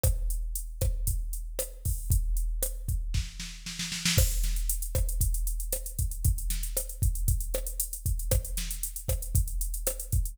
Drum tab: CC |----------------|----------------|x---------------|----------------|
HH |x-x-x-x-x-x-x-o-|x-x-x-x---------|-xxxxxxxxxxxxxxx|xxxxxxxxxxxxxxxx|
SD |r-----r-----r---|----r---o-o-oooo|r-o---r-----r---|--o-r-----r-----|
BD |o-----o-o-----o-|o-----o-o-------|o-----o-o-----o-|o-----o-o-----o-|

CC |----------------|
HH |xxxxxxxxxxxxxxxx|
SD |r-o---r-----r---|
BD |o-----o-o-----o-|